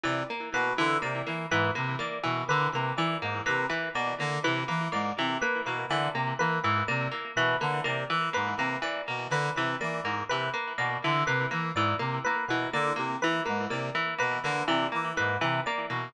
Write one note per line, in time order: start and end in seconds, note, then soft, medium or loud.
0.03 0.23 C3 medium
0.03 0.23 E3 medium
0.03 0.24 D5 medium
0.30 0.49 A#3 medium
0.53 0.73 B2 medium
0.53 0.73 A#3 medium
0.53 0.73 B4 medium
0.78 0.97 D3 medium
0.78 0.98 E3 medium
0.78 0.98 B4 medium
1.02 1.22 C3 medium
1.02 1.21 A#3 medium
1.02 1.22 D5 medium
1.27 1.46 E3 medium
1.27 1.46 A#3 medium
1.51 1.71 G#2 medium
1.51 1.71 E3 medium
1.51 1.71 B4 medium
1.75 1.96 C3 medium
1.75 1.95 A#3 medium
1.75 1.95 B4 medium
1.99 2.18 A#3 medium
1.99 2.20 D5 medium
2.23 2.44 B2 medium
2.23 2.43 E3 medium
2.48 2.68 D3 medium
2.48 2.70 A#3 medium
2.48 2.68 B4 medium
2.73 2.93 C3 medium
2.73 2.94 A#3 medium
2.73 2.93 B4 medium
2.97 3.16 E3 medium
2.97 3.18 E3 medium
2.97 3.17 D5 medium
3.22 3.41 G#2 medium
3.22 3.42 A#3 medium
3.46 3.66 C3 medium
3.46 3.65 A#3 medium
3.46 3.66 B4 medium
3.70 3.89 E3 medium
3.70 3.90 B4 medium
3.94 4.14 B2 medium
3.94 4.15 A#3 medium
3.94 4.15 D5 medium
4.19 4.39 D3 medium
4.19 4.40 A#3 medium
4.44 4.64 C3 medium
4.44 4.64 E3 medium
4.44 4.64 B4 medium
4.68 4.89 E3 medium
4.68 4.88 A#3 medium
4.68 4.88 B4 medium
4.92 5.12 G#2 medium
4.92 5.12 A#3 medium
4.92 5.12 D5 medium
5.18 5.37 C3 medium
5.18 5.38 E3 medium
5.42 5.62 A#3 medium
5.42 5.61 B4 medium
5.66 5.85 B2 medium
5.66 5.86 A#3 medium
5.66 5.85 B4 medium
5.89 6.08 D3 medium
5.89 6.10 E3 medium
5.89 6.10 D5 medium
6.14 6.33 C3 medium
6.14 6.34 A#3 medium
6.39 6.59 E3 medium
6.39 6.60 A#3 medium
6.39 6.59 B4 medium
6.63 6.83 G#2 medium
6.63 6.84 E3 medium
6.63 6.83 B4 medium
6.88 7.08 C3 medium
6.88 7.08 A#3 medium
6.88 7.07 D5 medium
7.11 7.31 A#3 medium
7.36 7.55 B2 medium
7.36 7.57 E3 medium
7.36 7.56 B4 medium
7.61 7.81 D3 medium
7.61 7.80 A#3 medium
7.61 7.81 B4 medium
7.84 8.05 C3 medium
7.84 8.04 A#3 medium
7.84 8.05 D5 medium
8.10 8.29 E3 medium
8.33 8.55 G#2 medium
8.33 8.53 A#3 medium
8.33 8.54 B4 medium
8.57 8.77 C3 medium
8.57 8.78 A#3 medium
8.57 8.78 B4 medium
8.82 9.02 E3 medium
8.82 9.03 D5 medium
9.08 9.27 B2 medium
9.08 9.27 A#3 medium
9.30 9.50 D3 medium
9.30 9.51 A#3 medium
9.30 9.51 B4 medium
9.56 9.75 C3 medium
9.56 9.77 E3 medium
9.56 9.76 B4 medium
9.81 10.01 E3 medium
9.81 10.00 A#3 medium
9.81 10.00 D5 medium
10.03 10.23 G#2 medium
10.03 10.24 A#3 medium
10.29 10.49 C3 medium
10.29 10.50 E3 medium
10.29 10.49 B4 medium
10.54 10.73 A#3 medium
10.54 10.73 B4 medium
10.78 10.98 B2 medium
10.78 10.98 A#3 medium
10.78 10.98 D5 medium
11.04 11.24 D3 medium
11.04 11.24 E3 medium
11.27 11.46 C3 medium
11.27 11.47 A#3 medium
11.27 11.46 B4 medium
11.51 11.72 E3 medium
11.51 11.70 A#3 medium
11.51 11.71 B4 medium
11.75 11.94 G#2 medium
11.75 11.96 E3 medium
11.75 11.95 D5 medium
11.99 12.19 C3 medium
11.99 12.19 A#3 medium
12.24 12.46 A#3 medium
12.24 12.44 B4 medium
12.48 12.67 B2 medium
12.48 12.70 E3 medium
12.48 12.68 B4 medium
12.73 12.93 D3 medium
12.73 12.93 A#3 medium
12.73 12.93 D5 medium
12.96 13.16 C3 medium
12.96 13.16 A#3 medium
13.21 13.41 E3 medium
13.21 13.43 E3 medium
13.21 13.42 B4 medium
13.46 13.67 G#2 medium
13.46 13.65 A#3 medium
13.46 13.66 B4 medium
13.70 13.90 C3 medium
13.70 13.90 A#3 medium
13.70 13.90 D5 medium
13.95 14.14 E3 medium
14.18 14.39 B2 medium
14.18 14.38 A#3 medium
14.18 14.39 B4 medium
14.43 14.63 D3 medium
14.43 14.64 A#3 medium
14.43 14.64 B4 medium
14.68 14.87 C3 medium
14.68 14.87 E3 medium
14.68 14.88 D5 medium
14.92 15.13 E3 medium
14.92 15.11 A#3 medium
15.17 15.38 G#2 medium
15.17 15.37 A#3 medium
15.17 15.37 B4 medium
15.41 15.61 C3 medium
15.41 15.61 E3 medium
15.41 15.61 B4 medium
15.66 15.86 A#3 medium
15.66 15.85 D5 medium
15.90 16.09 B2 medium
15.90 16.09 A#3 medium